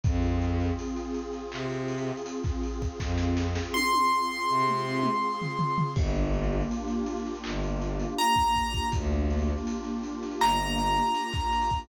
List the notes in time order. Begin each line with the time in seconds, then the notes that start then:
0.04 F2 C4 F4 G#4, kick, closed hi-hat
0.22 closed hi-hat
0.41 closed hi-hat
0.60 closed hi-hat
0.79 closed hi-hat
0.96 closed hi-hat
1.15 closed hi-hat
1.33 closed hi-hat
1.52 C3, clap
1.70 closed hi-hat
1.88 closed hi-hat
1.98 closed hi-hat
2.06 closed hi-hat
2.17 closed hi-hat
2.26 closed hi-hat
2.44 kick, snare, closed hi-hat
2.63 closed hi-hat
2.82 kick, closed hi-hat
2.99 F2, kick, snare
3.18 snare
3.37 snare
3.55 snare
3.74 C6, high tom
3.93 high tom
4.50 C3
4.67 mid tom
5.03 mid tom
5.42 floor tom
5.59 floor tom
5.78 floor tom
5.96 G1 A#3 D4 F4 G4, kick, crash
6.15 closed hi-hat
6.34 closed hi-hat
6.44 closed hi-hat
6.52 closed hi-hat
6.61 closed hi-hat
6.71 closed hi-hat
6.88 closed hi-hat
7.06 closed hi-hat
7.17 closed hi-hat
7.25 snare, closed hi-hat
7.35 closed hi-hat
7.44 G1, clap
7.63 closed hi-hat
7.81 closed hi-hat
8.00 closed hi-hat
8.19 A#5, closed hi-hat
8.36 kick, snare, closed hi-hat
8.56 kick, closed hi-hat
8.74 kick, closed hi-hat
8.92 D2, kick, closed hi-hat
9.11 closed hi-hat
9.30 closed hi-hat
9.39 closed hi-hat
9.48 closed hi-hat
9.58 closed hi-hat
9.67 closed hi-hat
9.84 closed hi-hat
10.03 closed hi-hat
10.23 snare, closed hi-hat
10.31 closed hi-hat
10.40 G1 A#5, clap
10.60 closed hi-hat
10.78 snare, closed hi-hat
10.87 closed hi-hat
10.96 closed hi-hat
11.06 closed hi-hat
11.15 closed hi-hat
11.33 kick, snare, closed hi-hat
11.52 closed hi-hat
11.62 closed hi-hat
11.70 kick, closed hi-hat
11.79 closed hi-hat